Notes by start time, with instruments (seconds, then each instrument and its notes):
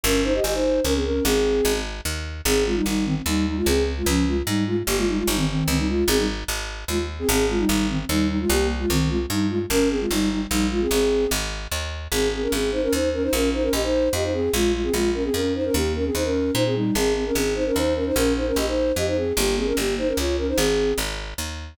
0.03 electric bass (finger) G1, flute C#4 A#4
0.24 flute D#4 C5
0.34 flute G4 D#5
0.44 electric bass (finger) G1, flute G4 D#5
0.53 flute D#4 C5
0.84 electric bass (finger) C#2, flute C#4 A#4
0.94 flute C4 G#4
1.04 flute C#4 A#4
1.24 electric bass (finger) G#1, flute C4 G#4
1.65 electric bass (finger) G#1
2.05 electric bass (finger) D#2
2.45 electric bass (finger) G#1, flute C4 G#4
2.66 flute G#3 F4
2.75 flute G3 D#4
2.86 electric bass (finger) G#1, flute G3 D#4
3.05 flute D#3 C4
3.26 electric bass (finger) D#2, flute G3 D#4
3.47 flute G3 D#4
3.57 flute G#3 F4
3.66 electric bass (finger) C#2, flute C4 G#4
3.97 flute G#3 F4
4.06 electric bass (finger) C#2, flute F3 C#4
4.27 flute G#3 F4
4.46 electric bass (finger) G#2, flute G3 D#4
4.67 flute G#3 F4
4.87 electric bass (finger) G1, flute A#3 G4
4.97 flute G#3 F4
5.08 flute G3 D#4
5.17 flute G#3 F4
5.27 electric bass (finger) G1, flute G3 D#4
5.36 flute D#3 C4
5.48 flute D#3 C4
5.68 electric bass (finger) C#2, flute D#3 C4
5.78 flute G3 D#4
5.88 flute G#3 F4
6.08 electric bass (finger) G#1, flute C4 G#4
6.17 flute G3 D#4
6.48 electric bass (finger) G#1
6.88 electric bass (finger) D#2, flute G#3 F4
7.19 flute C4 G#4
7.29 electric bass (finger) G#1, flute C4 G#4
7.49 flute G#3 F4
7.59 flute G3 D#4
7.68 electric bass (finger) G#1, flute G3 D#4
7.89 flute D#3 C4
8.09 electric bass (finger) D#2, flute G3 D#4
8.29 flute G3 D#4
8.40 flute G#3 F4
8.49 electric bass (finger) C2, flute A#3 G4
8.79 flute G#3 F4
8.90 electric bass (finger) C2, flute D#3 C4
9.09 flute G#3 F4
9.30 electric bass (finger) G2, flute G3 D#4
9.49 flute G#3 F4
9.70 electric bass (finger) G1, flute C#4 A#4
9.90 flute C4 G#4
9.99 flute G#3 F4
10.11 electric bass (finger) G1, flute G3 D#4
10.31 flute G3 D#4
10.50 electric bass (finger) A#1, flute G3 D#4
10.71 flute G#3 F4
10.81 flute C4 G#4
10.91 electric bass (finger) G#1, flute C4 G#4
11.31 electric bass (finger) G#1
11.71 electric bass (finger) D#2
12.12 electric bass (finger) G#1, flute C4 G#4
12.33 flute C4 G#4
12.42 flute C#4 A#4
12.52 electric bass (finger) G#1, flute C4 G#4
12.72 flute D#4 C5
12.83 flute C#4 A#4
12.93 electric bass (finger) D#2, flute D#4 C5
13.13 flute C#4 A#4
13.22 flute D#4 C5
13.33 electric bass (finger) A#1, flute C#4 A#4
13.53 flute D#4 C5
13.62 flute C#4 A#4
13.73 electric bass (finger) A#1, flute G4 D#5
13.83 flute D#4 C5
14.13 electric bass (finger) F2, flute G4 D#5
14.23 flute D#4 C5
14.33 flute C4 G#4
14.53 electric bass (finger) A#1, flute G#3 F4
14.73 flute G#3 F4
14.83 flute C4 G#4
14.93 electric bass (finger) A#1, flute G#3 F4
15.14 flute C#4 A#4
15.24 flute C4 G#4
15.34 electric bass (finger) F2, flute C#4 A#4
15.55 flute D#4 C5
15.65 flute C#4 A#4
15.74 electric bass (finger) D#2, flute A#3 G4
15.95 flute C#4 A#4
16.05 flute C4 G#4
16.14 electric bass (finger) D#2, flute D#4 C5
16.24 flute C#4 A#4
16.54 electric bass (finger) A#2, flute D#4 C5
16.66 flute C4 G#4
16.75 flute G3 D#4
16.95 electric bass (finger) G#1, flute C4 G#4
17.15 flute C4 G#4
17.26 flute C#4 A#4
17.35 electric bass (finger) G#1, flute C4 G#4
17.55 flute D#4 C5
17.66 flute C#4 A#4
17.76 electric bass (finger) D#2, flute D#4 C5
17.95 flute C#4 A#4
18.06 flute D#4 C5
18.15 electric bass (finger) A#1, flute C#4 A#4
18.36 flute D#4 C5
18.47 flute C#4 A#4
18.56 electric bass (finger) A#1, flute G4 D#5
18.67 flute D#4 C5
18.96 electric bass (finger) F2, flute G4 D#5
19.07 flute D#4 C5
19.16 flute C4 G#4
19.37 electric bass (finger) G1, flute A#3 G4
19.57 flute C4 G#4
19.66 flute C#4 A#4
19.77 electric bass (finger) G1, flute A#3 G4
19.98 flute D#4 C5
20.07 flute C#4 A#4
20.17 electric bass (finger) C#2, flute F4 C#5
20.37 flute C#4 A#4
20.48 flute D#4 C5
20.57 electric bass (finger) G#1, flute C4 G#4
20.98 electric bass (finger) G#1
21.38 electric bass (finger) D#2